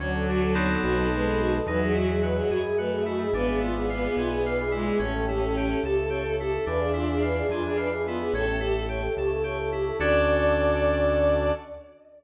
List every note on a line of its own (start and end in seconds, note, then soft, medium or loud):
0.00 0.77 D2 loud
0.00 1.07 F#3 loud
0.00 0.24 C#4 medium
0.00 0.81 C#5 medium
0.00 0.13 C#5 medium
0.00 0.81 D5 medium
0.00 0.81 F#5 medium
0.00 0.81 A5 medium
0.14 0.27 A4 medium
0.28 0.53 D4 medium
0.28 0.41 F#4 medium
0.42 0.55 A4 medium
0.55 1.57 B3 medium
0.55 1.57 C4 medium
0.55 1.57 D#4 medium
0.55 1.57 A4 medium
0.55 0.69 C#5 medium
0.70 0.82 A4 medium
0.82 1.60 B1 loud
0.82 0.95 F#4 medium
0.82 1.66 B4 medium
0.82 1.66 C5 medium
0.82 1.66 D#5 medium
0.82 1.66 A5 medium
0.98 1.10 A4 medium
1.11 1.58 G#3 loud
1.11 1.25 B4 medium
1.26 1.39 A4 medium
1.40 1.52 F#4 medium
1.53 1.65 A4 medium
1.67 2.42 E2 loud
1.67 2.58 F#3 loud
1.67 1.92 D#4 medium
1.67 1.80 B4 medium
1.67 2.50 D#5 medium
1.67 2.50 E5 medium
1.67 2.50 F#5 medium
1.67 2.50 G#5 medium
1.82 1.94 G#4 medium
1.94 2.19 E4 medium
1.94 2.08 F#4 medium
2.09 2.22 G#4 medium
2.22 2.47 F#4 medium
2.22 2.36 B4 medium
2.37 2.50 G#4 medium
2.49 3.25 F#2 medium
2.49 2.62 F#4 medium
2.49 2.76 G#4 medium
2.49 3.33 D#5 medium
2.49 3.32 E5 medium
2.49 3.32 G#5 medium
2.49 3.33 B5 medium
2.65 2.78 G#4 medium
2.78 3.26 A3 medium
2.78 3.03 F#4 medium
2.78 2.91 B4 medium
2.91 3.04 G#4 medium
3.06 3.31 E4 medium
3.06 3.19 F#4 medium
3.21 3.33 G#4 medium
3.33 4.08 G#1 medium
3.33 4.62 B3 loud
3.33 3.59 D4 medium
3.33 3.47 B4 medium
3.33 4.15 D5 medium
3.33 4.15 E5 medium
3.33 4.15 F5 medium
3.33 4.15 G#5 medium
3.47 3.60 G#4 medium
3.61 3.86 E4 medium
3.61 3.75 F4 medium
3.75 3.88 G#4 medium
3.89 4.14 F4 medium
3.89 4.03 B4 medium
4.03 4.16 G#4 medium
4.16 4.91 B1 medium
4.16 4.30 F4 medium
4.16 4.43 G#4 medium
4.16 4.99 B4 medium
4.16 4.99 D5 medium
4.16 4.99 E5 medium
4.16 4.99 G#5 medium
4.30 4.43 G#4 medium
4.44 4.71 F4 medium
4.44 4.57 B4 medium
4.59 4.72 G#4 medium
4.71 4.98 G#3 loud
4.71 4.96 E4 medium
4.71 4.85 F4 medium
4.86 4.99 G#4 medium
4.99 5.75 A1 loud
4.99 5.24 C#4 medium
4.99 5.80 C#4 loud
4.99 5.82 C#5 medium
4.99 5.13 C#5 medium
4.99 5.82 E5 medium
4.99 5.82 G5 medium
4.99 5.82 A5 medium
5.13 5.25 A4 medium
5.28 5.53 E4 medium
5.28 5.40 G4 medium
5.41 5.53 A4 medium
5.55 5.82 G4 medium
5.55 5.68 C#5 medium
5.70 5.82 A4 medium
5.82 6.58 C#2 medium
5.82 5.96 G4 medium
5.82 6.36 A4 loud
5.82 6.10 A4 medium
5.82 6.65 C#5 medium
5.82 6.65 E5 medium
5.82 6.65 A5 medium
5.82 6.65 C#6 medium
5.97 6.10 A4 medium
6.10 6.35 G4 medium
6.10 6.23 C#5 medium
6.24 6.37 A4 medium
6.39 6.65 E4 medium
6.39 6.51 G4 medium
6.39 6.65 A4 loud
6.53 6.65 A4 medium
6.66 7.42 E2 loud
6.66 6.91 D4 medium
6.66 7.88 D4 loud
6.66 6.80 B4 medium
6.66 7.49 D5 medium
6.66 7.49 E5 medium
6.66 7.49 F5 medium
6.66 7.49 G#5 medium
6.80 6.92 G#4 medium
6.93 7.18 E4 medium
6.93 7.07 F4 medium
7.09 7.22 G#4 medium
7.22 7.47 F4 medium
7.22 7.35 B4 medium
7.37 7.49 G#4 medium
7.49 8.24 F2 medium
7.49 7.63 F4 medium
7.49 7.76 G#4 medium
7.49 8.32 B4 medium
7.49 8.32 D5 medium
7.49 8.32 E5 medium
7.49 8.32 G#5 medium
7.65 7.78 G#4 medium
7.77 8.02 F4 medium
7.77 7.90 B4 medium
7.91 8.04 G#4 medium
8.05 8.32 B3 loud
8.05 8.32 E4 medium
8.05 8.18 F4 medium
8.20 8.33 G#4 medium
8.33 9.08 A1 loud
8.33 8.59 C#4 medium
8.33 8.87 A4 loud
8.33 8.46 C#5 medium
8.33 9.16 C#5 medium
8.33 9.16 E5 medium
8.33 9.16 G5 medium
8.33 9.16 A5 medium
8.47 8.60 A4 medium
8.60 8.85 E4 medium
8.60 8.73 G4 medium
8.74 8.86 A4 medium
8.89 9.14 G4 medium
8.89 9.02 C#5 medium
9.02 9.15 A4 medium
9.16 9.92 C#2 medium
9.16 9.29 G4 medium
9.16 9.43 A4 medium
9.16 9.99 C#5 medium
9.16 9.99 E5 medium
9.16 9.99 A5 medium
9.16 9.99 C#6 medium
9.31 9.44 A4 medium
9.44 9.69 G4 medium
9.44 9.58 C#5 medium
9.59 9.71 A4 medium
9.72 9.97 E4 medium
9.72 9.85 G4 medium
9.85 9.98 A4 medium
9.99 11.52 D2 loud
9.99 11.51 C#4 medium
9.99 11.52 C#4 loud
9.99 11.51 D4 loud
9.99 11.52 D4 loud
9.99 11.51 F#4 medium
9.99 11.52 F#4 medium
9.99 11.51 A4 loud
9.99 11.52 A4 loud
9.99 11.51 D5 loud
9.99 11.52 D5 loud